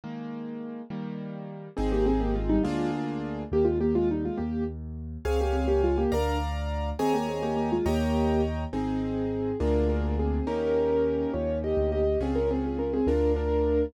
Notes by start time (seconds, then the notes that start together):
0.04 D#3 G#3 A#3
0.90 D#3 G3 A#3
1.77 G#1 C4 D#4 G#4
1.92 A#3 G4
2.06 C4 G#4
2.20 A#3 G4
2.35 G#3 F4
2.49 G3 D#4
2.63 D2 G#3 A#3 D4 F4 G#4
3.52 D#2 A#3 G4
3.65 G#3 F4
3.81 A#3 G4
3.95 G#3 F4
4.11 G3 D#4
4.25 G#3 F4
4.37 D#2 A#3 G4
5.25 C#2 C4 G#4 C#5 F5 G#5
5.41 A#3 G4
5.53 C4 G#4
5.68 A#3 G4
5.83 G#3 F4
5.98 A#3 G4
6.12 D2 D4 A#4 D5 F5 A#5
6.99 D#2 C4 G#4 C#5 D#5 G#5 A#5
7.14 A#3 G4
7.29 C4 G#4
7.42 A#3 G4
7.57 A#3 G4
7.72 G#3 F4
7.86 D#2 A#3 G4 C#5 D#5 G5 A#5
8.73 G#1 C4 D#4 G#4
9.60 D2 A#3 D4 F4 G#4 A#4
9.89 D4 A#4
10.19 C4 G#4
10.47 D#2 A#3 C#4 D#4 G4 A#4
11.34 D#2 F4 C#5
11.64 G4 D#5
11.77 D2
11.92 G4 D#5
12.20 C#2 C4 C#4 F4 G#4
12.35 C#4 A#4
12.51 C4 G#4
12.64 C4 G#4
12.79 C#4 A#4
12.94 C4 G#4
13.07 D2 D4 F4 A#4
13.36 D4 A#4